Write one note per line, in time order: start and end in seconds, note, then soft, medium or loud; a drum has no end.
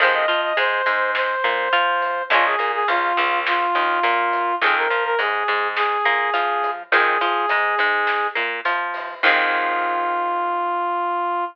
0.00 0.25 F2 loud
0.00 0.26 D#3 medium
0.00 0.26 F3 medium
0.00 0.26 G#3 medium
0.00 0.14 C5 loud
0.00 kick medium
0.00 closed hi-hat medium
0.04 0.26 C4 medium
0.14 0.41 D#5 loud
0.28 0.53 F3 medium
0.28 0.53 F4 medium
0.28 closed hi-hat medium
0.43 0.57 D#5 loud
0.57 0.82 G#2 medium
0.57 0.81 G#3 medium
0.57 1.11 C5 loud
0.57 closed hi-hat loud
0.86 1.36 G#2 medium
0.86 1.35 G#3 medium
0.86 closed hi-hat medium
1.15 2.23 C5 loud
1.15 snare loud
1.44 1.69 A#2 medium
1.44 1.69 A#3 medium
1.44 kick medium
1.44 closed hi-hat medium
1.73 2.22 F3 medium
1.73 2.22 F4 medium
1.73 closed hi-hat soft
2.02 closed hi-hat medium
2.30 2.55 A#1 loud
2.30 2.56 F3 medium
2.30 2.56 G#3 medium
2.30 2.56 A#3 medium
2.30 2.45 F4 loud
2.30 kick medium
2.30 closed hi-hat medium
2.34 2.56 C#4 medium
2.45 2.71 G#4 loud
2.59 2.84 A#2 medium
2.59 2.83 A#3 medium
2.59 closed hi-hat medium
2.74 2.88 G#4 loud
2.88 3.13 C#2 medium
2.88 3.12 C#3 medium
2.88 3.39 F4 loud
2.88 closed hi-hat loud
3.17 3.66 C#2 loud
3.17 3.68 C#3 medium
3.17 closed hi-hat medium
3.47 4.55 F4 loud
3.47 snare loud
3.75 4.00 D#2 medium
3.75 4.00 D#3 medium
3.75 closed hi-hat medium
4.03 4.53 A#2 medium
4.03 4.52 A#3 medium
4.03 closed hi-hat loud
4.33 kick medium
4.33 closed hi-hat medium
4.61 4.86 F2 loud
4.61 4.88 D#3 medium
4.61 4.88 F3 medium
4.61 4.88 G#3 medium
4.61 4.75 G#4 loud
4.61 kick loud
4.61 closed hi-hat medium
4.66 4.88 C4 medium
4.77 5.04 A#4 loud
4.90 5.15 F3 medium
4.90 5.16 F4 medium
4.90 kick medium
4.90 closed hi-hat medium
5.04 5.18 A#4 loud
5.19 5.44 G#2 medium
5.19 5.43 G#3 medium
5.19 5.68 G#4 loud
5.19 closed hi-hat loud
5.48 5.97 G#2 medium
5.48 5.98 G#3 medium
5.48 closed hi-hat medium
5.76 6.70 G#4 loud
5.76 snare loud
6.05 6.30 A#2 medium
6.05 6.30 A#3 medium
6.05 kick medium
6.05 closed hi-hat medium
6.34 6.84 F3 medium
6.34 6.83 F4 medium
6.34 closed hi-hat medium
6.63 kick medium
6.63 closed hi-hat medium
6.91 7.17 F2 loud
6.91 7.18 D#3 medium
6.91 7.18 F3 medium
6.91 7.18 G#3 medium
6.91 8.27 G#4 loud
6.91 kick loud
6.91 closed hi-hat medium
6.96 7.18 C4 medium
7.21 7.46 F3 loud
7.21 7.46 F4 medium
7.21 closed hi-hat medium
7.49 7.75 G#2 medium
7.49 7.76 G#3 medium
7.49 closed hi-hat medium
7.78 8.28 G#2 medium
7.78 8.29 G#3 medium
7.78 kick medium
7.78 closed hi-hat medium
8.07 snare medium
8.35 8.61 A#2 medium
8.35 8.60 A#3 medium
8.35 kick medium
8.35 closed hi-hat medium
8.65 9.14 F3 medium
8.65 9.14 F4 medium
8.65 closed hi-hat medium
8.94 open hi-hat medium
9.23 11.44 F2 loud
9.23 11.45 D#3 loud
9.23 11.45 F3 loud
9.23 11.45 G#3 medium
9.23 11.44 F4 loud
9.23 kick loud
9.23 crash loud
9.28 11.45 C4 loud